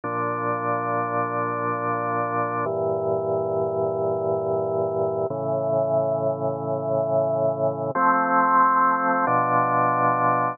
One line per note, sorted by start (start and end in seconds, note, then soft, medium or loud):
0.04 2.65 A#2 medium
0.04 2.65 F3 medium
0.04 2.65 D4 medium
2.65 5.26 G2 medium
2.65 5.26 A#2 medium
2.65 5.26 E3 medium
5.30 7.91 A2 medium
5.30 7.91 C#3 medium
5.30 7.91 E3 medium
7.95 9.25 F3 loud
7.95 9.25 A3 medium
7.95 9.25 C4 medium
9.27 10.57 B2 medium
9.27 10.57 F3 loud
9.27 10.57 D4 medium